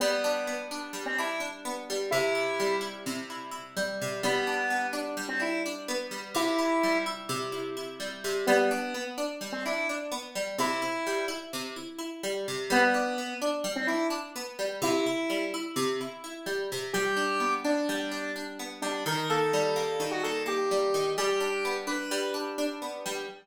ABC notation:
X:1
M:9/8
L:1/16
Q:3/8=85
K:G
V:1 name="Lead 1 (square)"
B,6 z3 C E2 z6 | E6 z12 | B,6 z3 C E2 z6 | E6 z12 |
B,6 z3 C E2 z6 | E6 z12 | B,6 z3 C E2 z6 | E6 z12 |
G6 D6 z4 D2 | _B2 A7 F A2 G6 | G6 B4 z8 |]
V:2 name="Acoustic Guitar (steel)"
G,2 D2 B,2 D2 G,2 D2 D2 B,2 G,2 | C,2 E2 G,2 E2 C,2 E2 E2 G,2 C,2 | G,2 D2 B,2 D2 G,2 D2 D2 B,2 G,2 | C,2 E2 G,2 E2 C,2 E2 E2 G,2 C,2 |
G,2 D2 B,2 D2 G,2 D2 D2 B,2 G,2 | C,2 E2 G,2 E2 C,2 E2 E2 G,2 C,2 | G,2 D2 B,2 D2 G,2 D2 D2 B,2 G,2 | C,2 E2 G,2 E2 C,2 E2 E2 G,2 C,2 |
G,2 D2 B,2 D2 G,2 D2 D2 B,2 G,2 | _E,2 _B,2 G,2 B,2 E,2 B,2 B,2 G,2 E,2 | G,2 D2 B,2 D2 G,2 D2 D2 B,2 G,2 |]